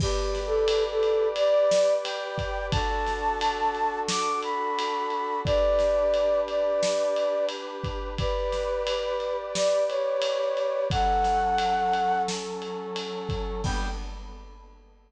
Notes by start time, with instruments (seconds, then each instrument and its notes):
0.00 flute G4, brass section G4 B4 D5, kick, crash
0.35 snare, ride
0.46 flute A4
0.68 ride
0.91 flute A4
1.03 ride
1.36 flute D5, ride
1.71 snare
2.04 flute G5, ride
2.38 kick, ride
2.71 brass section D4 F#4 A4, flute A5, kick, ride
3.07 snare, ride
3.41 ride
3.75 ride
4.09 flute D6, snare
4.43 flute B5, ride
4.79 ride
5.10 ride
5.44 brass section D4 G4 B4, flute D5, kick, ride
5.79 snare, ride
6.14 ride
6.48 flute D5, ride
6.83 snare
7.16 ride
7.49 ride
7.84 kick, ride
8.18 brass section G4 B4 D5, flute B4, kick, ride
8.52 snare, ride
8.87 ride
9.20 ride
9.55 flute D5, snare
9.88 flute C#5, ride
10.22 ride
10.57 ride
10.90 brass section F#3 C#4 A4, flute F#5, kick, ride
11.24 snare, ride
11.58 ride
11.93 ride
12.28 snare
12.62 ride
12.96 ride
13.29 kick, ride
13.64 brass section G3 B3 D4, flute G5, kick, crash